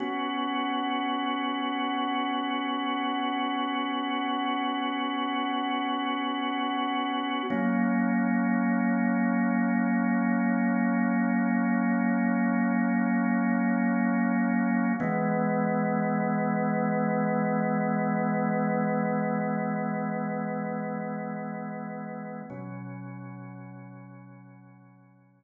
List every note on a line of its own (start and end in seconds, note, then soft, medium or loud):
0.00 7.43 B3 loud
0.00 7.43 C#4 medium
0.00 7.43 F#4 medium
7.50 14.93 F#3 medium
7.50 14.93 A#3 loud
7.50 14.93 C#4 medium
15.00 22.42 E3 loud
15.00 22.42 G#3 loud
15.00 22.42 B3 loud
22.50 25.44 B2 loud
22.50 25.44 F#3 loud
22.50 25.44 C#4 loud